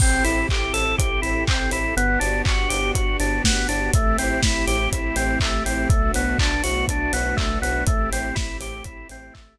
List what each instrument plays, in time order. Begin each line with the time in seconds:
0.00 synth bass 2 A1, string ensemble 1 C4 E4 G4 A4, drawbar organ C4, kick, crash
0.24 synth bass 2 A1, drawbar organ E4, open hi-hat
0.49 synth bass 2 A1, drawbar organ G4, kick, clap
0.73 synth bass 2 A1, drawbar organ A4, open hi-hat
0.98 synth bass 2 A1, drawbar organ G4, kick, closed hi-hat
1.22 synth bass 2 A1, drawbar organ E4, open hi-hat
1.47 synth bass 2 A1, drawbar organ C4, kick, clap
1.71 synth bass 2 A1, drawbar organ E4, open hi-hat
1.97 synth bass 2 G1, drawbar organ B3, string ensemble 1 B3 D4 F#4 G4, closed hi-hat
2.20 synth bass 2 G1, drawbar organ D4, open hi-hat
2.45 synth bass 2 G1, drawbar organ F#4, kick, clap
2.69 synth bass 2 G1, drawbar organ G4, open hi-hat
2.95 synth bass 2 G1, drawbar organ F#4, kick, closed hi-hat
3.20 synth bass 2 G1, drawbar organ D4, open hi-hat
3.44 synth bass 2 G1, drawbar organ B3, kick, snare
3.69 synth bass 2 G1, drawbar organ D4, open hi-hat
3.93 synth bass 2 A1, string ensemble 1 A3 C4 E4 G4, drawbar organ A3, kick, closed hi-hat
4.18 synth bass 2 A1, drawbar organ C4, open hi-hat
4.43 synth bass 2 A1, drawbar organ E4, kick, snare
4.67 synth bass 2 A1, drawbar organ G4, open hi-hat
4.92 synth bass 2 A1, drawbar organ E4, kick, closed hi-hat
5.16 synth bass 2 A1, drawbar organ C4, open hi-hat
5.40 synth bass 2 A1, drawbar organ A3, kick, clap
5.66 synth bass 2 A1, drawbar organ C4, open hi-hat
5.89 synth bass 2 B1, drawbar organ A3, string ensemble 1 A3 B3 D4 F#4, kick, closed hi-hat
6.14 synth bass 2 B1, drawbar organ B3, open hi-hat
6.39 synth bass 2 B1, drawbar organ D4, kick, clap
6.63 synth bass 2 B1, drawbar organ F#4, open hi-hat
6.88 synth bass 2 B1, drawbar organ D4, kick, closed hi-hat
7.13 synth bass 2 B1, drawbar organ B3, open hi-hat
7.37 synth bass 2 B1, drawbar organ A3, kick, clap
7.62 synth bass 2 B1, drawbar organ B3, open hi-hat
7.86 synth bass 2 A1, string ensemble 1 A3 C4 E4 G4, drawbar organ A3, kick, closed hi-hat
8.11 synth bass 2 A1, drawbar organ C4, open hi-hat
8.35 synth bass 2 A1, drawbar organ E4, kick, snare
8.60 synth bass 2 A1, drawbar organ G4, open hi-hat
8.84 synth bass 2 A1, drawbar organ E4, kick, closed hi-hat
9.09 synth bass 2 A1, drawbar organ C4, open hi-hat
9.34 synth bass 2 A1, drawbar organ A3, kick, clap